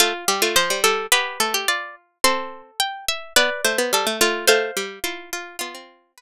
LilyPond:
<<
  \new Staff \with { instrumentName = "Harpsichord" } { \time 2/4 \key g \mixolydian \tempo 4 = 107 f''8. r16 c''8 a'8 | b'4 r4 | c'''8. r16 g''8 e''8 | d''8. r16 a'8 f'8 |
c''8. r16 f'8 f'8 | f'4 b'8 r8 | }
  \new Staff \with { instrumentName = "Harpsichord" } { \time 2/4 \key g \mixolydian f'8 g'16 f'16 c''8 r8 | g'8 a'16 g'16 d''8 r8 | a'2 | b'8 c''4 r8 |
f''4. r8 | f'4 r4 | }
  \new Staff \with { instrumentName = "Harpsichord" } { \time 2/4 \key g \mixolydian a16 r16 g16 a16 f16 g16 g8 | b8 a8 f'4 | c'4 r4 | b16 r16 a16 b16 g16 a16 a8 |
a8 g8 e'4 | b16 c'8. r4 | }
>>